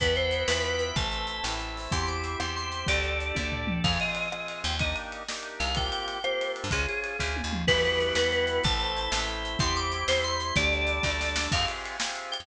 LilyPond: <<
  \new Staff \with { instrumentName = "Electric Piano 2" } { \time 6/8 \key e \minor \tempo 4. = 125 b'8 c''4 b'8 b'4 | a''2 r4 | c'''8 d'''4 c'''8 c'''4 | d''2. |
\key f \minor f''8 ees''8 ees''4. g''8 | ees''8 r2 f''8 | g''8 g''4 c''4 r8 | aes'8 aes'4. r4 |
\key e \minor b'8 b'4 b'8 b'4 | a''2 r4 | c'''8 d'''4 c''8 c'''4 | d''2. |
\key f \minor f''8 r2 g''8 | }
  \new Staff \with { instrumentName = "Drawbar Organ" } { \time 6/8 \key e \minor b8 e'8 fis'8 f'8 fis'8 e'8 | a8 c'8 e'8 c'8 a8 c'8 | g'8 c''8 e''8 c''8 g'8 c''8 | g'8 a'8 d''8 a'8 g'8 a'8 |
\key f \minor <c' f' aes'>4. <c' f' aes'>4. | <bes d' ees' g'>4. <bes d' ees' g'>4. | <bes c' f' g'>4. <bes c' f' g'>4. | <des' f' aes'>4. <des' f' aes'>4. |
\key e \minor g8 b8 e'8 fis'8 e'8 b8 | a8 c'8 e'8 c'8 a8 c'8 | g8 c'8 e'8 c'8 g8 c'8 | g8 a8 d'8 a8 g8 a8 |
\key f \minor <c' f' g' aes'>4. <c' f' g' aes'>4. | }
  \new Staff \with { instrumentName = "Electric Bass (finger)" } { \clef bass \time 6/8 \key e \minor e,4. e,4. | a,,4. a,,4. | e,4. e,4. | d,4. d,4. |
\key f \minor f,2~ f,8 ees,8~ | ees,2~ ees,8 c,8~ | c,2~ c,8. g,16 | des,4. d,8. ees,8. |
\key e \minor e,4. e,4. | a,,4. a,,4. | e,4. e,4. | d,4. d,4. |
\key f \minor f,2~ f,8. f,16 | }
  \new Staff \with { instrumentName = "Drawbar Organ" } { \time 6/8 \key e \minor <b' e'' fis'' g''>4. <b' e'' g'' b''>4. | <a' c'' e''>4. <e' a' e''>4. | <c' e' g'>4. <c' g' c''>4. | <d' g' a'>4. <d' a' d''>4. |
\key f \minor r2. | r2. | r2. | r2. |
\key e \minor <e' fis' g' b'>4. <b e' fis' b'>4. | <e' a' c''>4. <e' c'' e''>4. | <e' g' c''>4. <c' e' c''>4. | <d' g' a'>4. <d' a' d''>4. |
\key f \minor r2. | }
  \new DrumStaff \with { instrumentName = "Drums" } \drummode { \time 6/8 <hh bd>8 hh8 hh8 sn8 hh8 hh8 | <hh bd>8 hh8 hh8 sn8 hh8 hho8 | <hh bd>8 hh8 hh8 ss8 hh8 hh8 | <hh bd>8 hh8 hh8 <bd tommh>8 tomfh8 toml8 |
<cymc bd>8 cymr8 cymr8 ss8 cymr8 cymr8 | <bd cymr>8 cymr8 cymr8 sn8 cymr8 cymr8 | <bd cymr>8 cymr8 cymr8 ss8 cymr8 cymr8 | <bd cymr>8 cymr8 cymr8 <bd sn>8 tommh8 toml8 |
<cymc bd>8 hh8 hh8 sn8 hh8 hh8 | <hh bd>8 hh8 hh8 sn8 hh8 hh8 | <hh bd>8 hh8 hh8 sn8 hh8 hh8 | <hh bd>8 hh8 hh8 <bd sn>8 sn8 sn8 |
<cymc bd>8 cymr8 cymr8 sn8 cymr8 cymr8 | }
>>